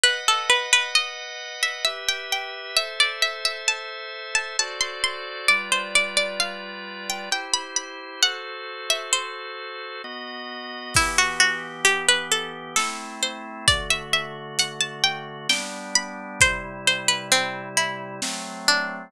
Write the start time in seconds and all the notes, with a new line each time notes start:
0.03 B4 D#5 F#5
0.28 A4
0.50 B4
0.73 B4
0.95 D#5
1.63 E5
1.84 G4 B4 E5
2.09 G5
2.32 G5
2.77 A4 C5 E5
3.00 D5
3.22 E5
3.45 E5
3.68 A5
4.35 A5
4.59 F#4 A4 C5 D5 A5
4.80 C6
5.04 C6
5.48 G3 F4 B4 D5
5.72 C5
5.95 D5
6.17 D5
6.40 F5
7.09 G5
7.31 E4 G4 C5 G5
7.53 B5
7.76 B5
8.22 F#4 A4 C5 F#5
8.90 E5
9.13 C5
10.04 B3 F#4 D#5
10.94 E3 B3 E4 G4, kick, crash
11.18 F#4
11.40 F#4
11.85 G4, closed hi-hat
12.09 B4
12.31 A4
12.76 A3 C4 E4 A4, snare
13.23 C5
13.68 D3 A3 F#4 D5, kick, closed hi-hat
13.90 E5
14.13 E5
14.59 F#5, closed hi-hat
14.80 A5
15.04 G5
15.49 G3 B3 D4 G5, snare
15.95 B5
16.40 C3 G3 E4 C5, kick, closed hi-hat
16.87 C5
17.08 B4
17.32 C4, closed hi-hat
17.77 E4
18.22 F#3 A3 C4, snare
18.68 D4